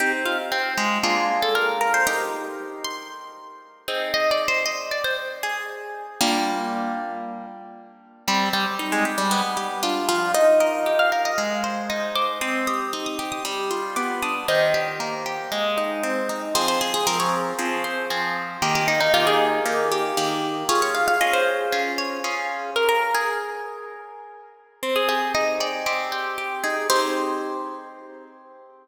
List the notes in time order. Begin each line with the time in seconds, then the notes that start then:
0.00 C4 D#4 G4
0.26 F4
0.52 C4
0.77 G#3
1.03 A#3 D4 F4 G#4
1.42 A4
1.55 A#4
1.81 A#4
1.94 C5
2.07 D#4 G4 A#4 G5 A#5
2.84 C6
3.88 C4 D#4 G#4
4.14 D#5
4.31 D5
4.48 C5
4.66 D#5
4.91 D5
5.04 C5
5.43 G#4
6.21 G3 A#3 D4 F4
8.28 G3 C4
8.53 G3 G4
8.79 D#4
8.92 G#3
9.05 G4
9.18 G3
9.31 B3
9.57 G4
9.83 D4 F4
10.09 F3 F4
10.34 D#4 D#5
10.60 A#4 D#5
10.86 G4
10.99 F5
11.12 A#4
11.25 D#5
11.38 G#3
11.64 C5
11.90 D#4 D#6
12.15 C5 D6
12.41 C4 D#6
12.67 G4 D#6
12.93 D#4
13.06 D#6
13.19 G4
13.32 D#6
13.45 G3
13.71 F4
13.96 B3 D6
14.22 D4 D#6
14.48 D#3 C5 D#5
14.74 G4
15.00 A#3
15.26 G4
15.52 G#3
15.78 D#4
16.03 C4
16.29 D#4
16.55 F3 C4 G#4 C5
16.68 C5
16.81 G#4
16.94 G#4
17.07 F3 C4 G#4 A#4
17.20 C#5
17.59 F3 C4 G#4
17.84 C5
18.10 F3 C4 G#4
18.62 D#3 A#3 G4
18.75 G4
18.88 D#4
19.01 D#4
19.14 D#3 A#3 F4 G4
19.27 G#4
19.66 D#3 A#3 G4
19.92 G4
20.17 D#3 A#3 G4
20.69 C#4 F4 G#4 C#5
20.82 C#5
20.95 F5
21.08 F5
21.21 C#4 F4 G#4 D#5
21.33 C5
21.72 C#4 F4 G#4
21.98 C#5
22.24 C#4 F4 G#4
22.76 A#4
22.89 A#4
23.15 G#4
24.83 C4
24.96 G#4
25.09 G4 G#4
25.34 D#4 D#5
25.60 G4 D5
25.86 C4 G4
26.12 G4
26.38 G4
26.64 D#4 G#4
26.90 C4 D#4 G4 C5